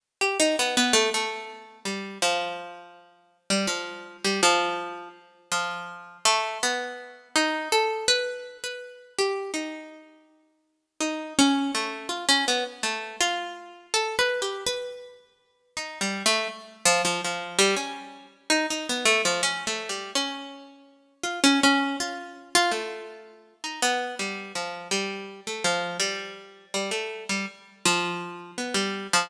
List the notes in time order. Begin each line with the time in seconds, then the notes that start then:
0.21 G4
0.40 D#4
0.59 B3
0.77 B3
0.93 A3
1.14 A3
1.85 G3
2.22 F3
3.50 G3
3.67 F3
4.24 G3
4.43 F3
5.52 F3
6.25 A3
6.63 B3
7.36 D#4
7.72 A4
8.08 B4
8.64 B4
9.18 G4
9.54 D#4
11.00 D#4
11.39 C#4
11.75 A3
12.09 F4
12.29 C#4
12.48 B3
12.83 A3
13.21 F4
13.94 A4
14.19 B4
14.42 G4
14.66 B4
15.77 D#4
16.01 G3
16.26 A3
16.85 F3
17.05 F3
17.25 F3
17.59 G3
17.77 C#4
18.50 D#4
18.70 D#4
18.89 B3
19.05 A3
19.25 F3
19.43 C#4
19.67 A3
19.89 G3
20.15 C#4
21.23 F4
21.44 C#4
21.63 C#4
22.00 F4
22.55 F4
22.71 A3
23.64 D#4
23.82 B3
24.19 G3
24.55 F3
24.91 G3
25.47 A3
25.64 F3
26.00 G3
26.74 G3
26.91 A3
27.29 G3
27.85 F3
28.58 B3
28.74 G3
29.13 F3